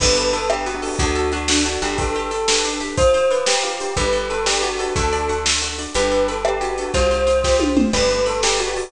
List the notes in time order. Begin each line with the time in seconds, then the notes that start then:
0.00 G1 B3 D4 G4 A4 B4, kick, crash
0.08 B3 D4 G4 A4
0.16 A4, closed hi-hat
0.33 B3 A4, closed hi-hat
0.50 B3 D4 G4 A4, cross-stick
0.66 B3 F#4, closed hi-hat
0.75 B3 D4 G4 A4
0.82 B3 D4 G4 A4, open hi-hat
0.99 D2 D4 F#4 A4, kick, closed hi-hat
1.06 D4 F#4 A4
1.15 A4, closed hi-hat
1.32 D4 F#4, closed hi-hat
1.48 D4 F#4 A4, snare
1.65 D4 F#4, closed hi-hat
1.73 D4 F#4 A4
1.82 G1 D4 F#4 G4 A4, closed hi-hat
1.98 D4 G4 A4 B4, kick, closed hi-hat
2.07 D4 G4 A4 B4
2.15 G4, closed hi-hat
2.31 A4, closed hi-hat
2.48 D4 G4 A4 B4, snare
2.64 D4, closed hi-hat
2.73 D4 G4 A4 B4
2.80 D4 G4 A4 B4, closed hi-hat
2.97 F4 C5, kick, closed hi-hat
3.14 C5, closed hi-hat
3.31 F4 B4, closed hi-hat
3.46 G4, snare
3.63 F4 G4, closed hi-hat
3.80 C5, closed hi-hat
3.97 G1 D4 G4 A4 B4, kick, closed hi-hat
4.05 D4 G4 A4 B4
4.13 A4, closed hi-hat
4.30 A4 B4, closed hi-hat
4.46 D4 G4 A4 B4 D5, snare
4.62 F#4 G4, closed hi-hat
4.71 D4 G4 A4 B4
4.79 D4 G4 A4 B4, closed hi-hat
4.96 D2 D4 F#4 A4, kick, closed hi-hat
5.04 D4 F#4 A4
5.13 D5, closed hi-hat
5.29 F#4, closed hi-hat
5.44 D4 F#4 A4, snare
5.62 F#4, closed hi-hat
5.69 D4 F#4 A4
5.78 D4 F#4 A4 D5, closed hi-hat
5.94 G1 D4 G4 A4 B4, closed hi-hat
6.03 D4 G4 A4 B4
6.11 A4, closed hi-hat
6.28 A4 B4, closed hi-hat
6.44 D4 G4 A4 B4 D5, cross-stick
6.61 F#4 G4, closed hi-hat
6.70 D4 G4 A4 B4
6.78 D4 G4 A4 B4, closed hi-hat
6.94 C2 F4 G4 C5, kick, closed hi-hat
7.03 F4 G4 C5
7.11 C5, closed hi-hat
7.27 F4, closed hi-hat
7.44 F4 G4 C5, kick, snare
7.60 F4, high tom
7.68 F4 G4 C5
7.77 F4 G4 C5, mid tom
7.93 G1 G4 A4 B4 D5 G5, kick, crash
8.02 G4 A4 B4 D5
8.10 A5, closed hi-hat
8.26 A4 B5, closed hi-hat
8.42 G4 A4 B4 D5 D6, snare
8.59 F#4 G5, closed hi-hat
8.67 G4 A4 B4 D5
8.76 G4 A4 B4 D5 A5, open hi-hat